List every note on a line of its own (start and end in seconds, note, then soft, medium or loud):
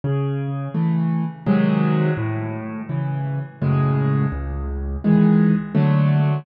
0.04 0.68 C#3 medium
0.74 1.24 E3 medium
0.74 1.24 A3 medium
1.46 2.11 C3 loud
1.46 2.11 D#3 medium
1.46 2.11 F#3 medium
1.46 2.11 G#3 medium
2.17 2.82 A2 loud
2.89 3.39 C#3 medium
2.89 3.39 E3 medium
3.62 4.26 F#2 medium
3.62 4.26 A2 medium
3.62 4.26 C#3 medium
3.62 4.26 G#3 medium
4.32 4.97 C#2 loud
5.04 5.54 D#3 medium
5.04 5.54 E3 medium
5.04 5.54 G#3 medium
5.75 6.39 D3 medium
5.75 6.39 F#3 medium
5.75 6.39 A3 medium